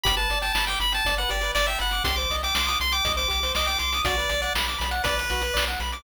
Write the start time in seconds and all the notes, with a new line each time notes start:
0.04 G1 G4 B5, kick, closed hi-hat
0.17 B4 A5, closed hi-hat
0.30 G1 D5, closed hi-hat
0.42 G5 A5, closed hi-hat
0.53 G1 A5 B5, snare
0.67 G5 D6, closed hi-hat
0.80 G1 B5, closed hi-hat
0.92 G5 A5, closed hi-hat
1.05 G1 D5, kick, closed hi-hat
1.17 B4 F#5, closed hi-hat
1.29 G1 G4 D5, closed hi-hat
1.41 B4, closed hi-hat
1.55 G1 D5, snare
1.67 E5 G5, closed hi-hat
1.79 G1 F#5 B5, closed hi-hat
1.91 D6, closed hi-hat
2.04 C2 G4 C6, kick, closed hi-hat
2.16 C5 D6, closed hi-hat
2.30 C2 D#5, closed hi-hat
2.43 G5 D6, closed hi-hat
2.55 C2 C6 D6, snare
2.67 D6 D#6, closed hi-hat
2.80 C2 C6, closed hi-hat
2.92 G5 D6, closed hi-hat
3.05 C2 D#5, kick, closed hi-hat
3.16 C5 D6, closed hi-hat
3.28 C2 G4 D6, closed hi-hat
3.43 C5, closed hi-hat
3.55 C2 D#5 D6, snare
3.66 G5 D6, closed hi-hat
3.79 C2 C6 D6, closed hi-hat
3.93 D#6, closed hi-hat
4.05 B1 F#4 D5, kick, closed hi-hat
4.18 B4, closed hi-hat
4.29 B1 D5, closed hi-hat
4.42 D5 F#5, closed hi-hat
4.55 B1 B5, snare
4.67 D6, closed hi-hat
4.79 B1 B5, closed hi-hat
4.91 F#5, closed hi-hat
5.04 B1 B4 D5, kick, closed hi-hat
5.18 B4, closed hi-hat
5.30 B1 F#4, closed hi-hat
5.42 B4, closed hi-hat
5.54 B1 D5, snare
5.68 F#5, closed hi-hat
5.80 B1 B5, closed hi-hat
5.92 D6, closed hi-hat